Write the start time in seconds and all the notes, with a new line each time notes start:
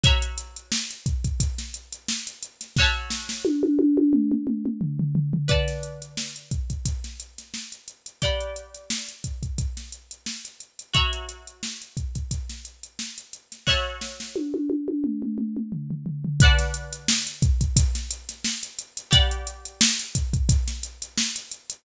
0.03 F#4 C#5 E5 A#5, kick, closed hi-hat
0.22 closed hi-hat
0.38 closed hi-hat
0.56 closed hi-hat
0.72 snare
0.90 closed hi-hat
1.06 kick, closed hi-hat
1.24 kick, closed hi-hat
1.40 kick, closed hi-hat
1.58 snare, closed hi-hat
1.74 closed hi-hat
1.92 closed hi-hat
2.08 snare
2.27 closed hi-hat
2.43 closed hi-hat
2.61 snare, closed hi-hat
2.76 F#4 C#5, kick, snare
2.81 E5 A5
3.10 snare
3.29 snare
3.45 high tom
3.63 high tom
3.79 high tom
3.97 high tom
4.13 mid tom
4.32 mid tom
4.47 mid tom
4.65 mid tom
4.81 floor tom
4.99 floor tom
5.15 floor tom
5.33 floor tom
5.48 B4 D5 F#5 A5, kick, closed hi-hat
5.68 snare, closed hi-hat
5.83 closed hi-hat
6.02 closed hi-hat
6.17 snare
6.36 closed hi-hat
6.51 kick, closed hi-hat
6.70 kick, closed hi-hat
6.85 kick, closed hi-hat
7.04 snare, closed hi-hat
7.20 closed hi-hat
7.38 snare, closed hi-hat
7.54 snare
7.72 closed hi-hat
7.88 closed hi-hat
8.06 closed hi-hat
8.22 G4 D5 F#5 B5, kick, closed hi-hat
8.40 closed hi-hat
8.56 closed hi-hat
8.74 closed hi-hat
8.90 snare
9.08 closed hi-hat
9.24 kick, closed hi-hat
9.43 kick, closed hi-hat
9.58 kick, closed hi-hat
9.77 snare, closed hi-hat
9.92 closed hi-hat
10.11 closed hi-hat
10.26 snare
10.45 closed hi-hat
10.60 closed hi-hat
10.79 closed hi-hat
10.93 F#4 C#5 E5 A#5, kick, closed hi-hat
11.13 closed hi-hat
11.29 closed hi-hat
11.47 closed hi-hat
11.63 snare
11.82 closed hi-hat
11.97 kick, closed hi-hat
12.15 kick, closed hi-hat
12.31 kick, closed hi-hat
12.49 snare, closed hi-hat
12.65 closed hi-hat
12.83 closed hi-hat
12.99 snare
13.18 closed hi-hat
13.33 closed hi-hat
13.52 snare, closed hi-hat
13.67 F#4 C#5 E5 A5, kick, snare
14.01 snare
14.20 snare
14.36 high tom
14.54 high tom
14.70 high tom
14.88 high tom
15.04 mid tom
15.22 mid tom
15.38 mid tom
15.57 mid tom
15.72 floor tom
15.90 floor tom
16.06 floor tom
16.24 floor tom
16.40 B4 D5 F#5, kick, closed hi-hat
16.45 A5
16.59 snare, closed hi-hat
16.74 closed hi-hat
16.93 closed hi-hat
17.08 snare
17.27 closed hi-hat
17.42 kick, closed hi-hat
17.61 kick, closed hi-hat
17.76 kick, closed hi-hat
17.95 snare, closed hi-hat
18.11 closed hi-hat
18.29 snare, closed hi-hat
18.44 snare
18.63 closed hi-hat
18.79 closed hi-hat
18.97 closed hi-hat
19.11 G4 D5 F#5 B5, kick, closed hi-hat
19.31 closed hi-hat
19.47 closed hi-hat
19.65 closed hi-hat
19.81 snare
19.99 closed hi-hat
20.15 kick, closed hi-hat
20.33 kick, closed hi-hat
20.49 kick, closed hi-hat
20.68 snare, closed hi-hat
20.83 closed hi-hat
21.02 closed hi-hat
21.17 snare
21.36 closed hi-hat
21.51 closed hi-hat
21.70 closed hi-hat